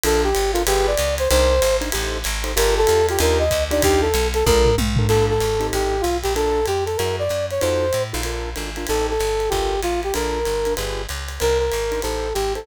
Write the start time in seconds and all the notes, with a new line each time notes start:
0.03 A#1 D4 F4 A4 A#4, ride
0.24 G4
0.35 G1, ride
0.53 D4 F4 A4 A#4, hi-hat pedal, ride
0.67 G1 F4 G4 G#4 B4, ride
0.87 D5
0.97 C#2, hi-hat pedal, ride
1.18 C5, ride
1.30 C2 D4 D#4 A#4 C5, ride
1.62 G#1, hi-hat pedal, ride
1.81 D4 D#4 A#4 C5, ride
1.92 A1 D#4 G4 A4 C5, ride
2.24 G#1, hi-hat pedal, ride
2.44 D#4 G4 A4 C5, ride
2.56 G1 F4 G4 A4 A#4, ride
2.77 A4
2.87 E2 F4 G4 A4 A#4, hi-hat pedal, ride
3.09 F4 G4 A4 A#4, ride
3.19 D#2 D4 D#4 F4 G4 A#4, ride
3.39 D#5
3.51 D2, kick, hi-hat pedal, ride
3.71 D4 D#4 F4 G4 D5, ride
3.82 D#2 G4, kick, ride
4.01 A4
4.14 B1, hi-hat pedal, ride
4.34 A4, ride
4.46 A#1 D4 F4 A4 A#4, kick, high tom
4.65 floor tom
4.78 B1, high tom
4.96 D4 F4 A4 A#4, floor tom
5.09 A#1 A#3 D4 F4 A4, crash, ride
5.30 A4
5.40 G#1, hi-hat pedal, ride
5.60 C4 D#4 G4 A4, ride
5.73 A1 G4, ride
6.01 B1 F4, hi-hat pedal, ride
6.23 A#1 G4, ride
6.35 D4 F4 A4 A#4, ride
6.66 F2 G4, hi-hat pedal, ride
6.86 A4, ride
6.97 F#2 E4 F#4 G#4 A#4, ride
7.19 D5
7.29 F#2, hi-hat pedal, ride
7.51 C#5, ride
7.60 F2 D#4 F4 F#4 A4 C5, ride
7.93 A2, hi-hat pedal, ride
8.13 A#1 D#4 F4 F#4 A4, ride
8.23 D4 F4 A4 A#4, ride
8.56 G#1 D4 F4 A4 A#4, hi-hat pedal, ride
8.76 D4 F4 A4 A#4, ride
8.87 A1 C4 D#4 G4 A4, ride
9.10 A4
9.19 G1, hi-hat pedal, ride
9.40 ride
9.49 G1 F4 G4 A4 A#4, kick, ride
9.82 A1 F4, hi-hat pedal, ride
10.03 G4, ride
10.14 A#1 D4 F4 A4 A#4, ride
10.45 G1, ride
10.65 D4 F4 A4 A#4, hi-hat pedal, ride
10.77 G1 F4 G4 G#4 B4, ride
11.09 C#2, hi-hat pedal, ride
11.28 ride
11.40 C2 D4 D#4 A#4 C5, ride
11.59 A#4
11.72 G#1, hi-hat pedal, ride
11.92 D4 D#4 A#4 C5, ride
12.02 A1 D#4 G4 A4 C5, ride
12.34 G#1 G4, hi-hat pedal, ride
12.55 D#4 G4 A4 C5, ride